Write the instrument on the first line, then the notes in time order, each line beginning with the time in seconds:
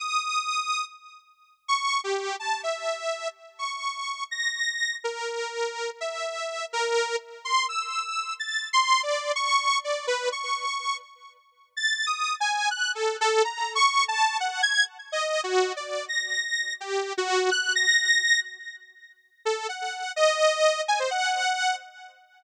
lead 2 (sawtooth)
0.00 D#6
1.68 C#6
2.04 G4
2.40 A5
2.63 E5
3.59 C#6
4.31 A#6
5.04 A#4
6.01 E5
6.73 A#4
7.45 C6
7.69 E6
8.39 A6
8.73 C6
9.03 D5
9.36 C#6
9.84 D5
10.07 B4
10.32 C#6
11.77 A6
12.06 D#6
12.40 G#5
12.71 F#6
12.95 A4
13.21 A4
13.44 A#5
13.75 C#6
14.08 A5
14.40 F#5
14.62 G#6
15.12 D#5
15.44 F#4
15.76 D5
16.08 A#6
16.80 G4
17.18 F#4
17.51 F#6
17.75 A#6
19.45 A4
19.69 F#5
20.16 D#5
20.88 G#5
20.99 C5
21.11 F#5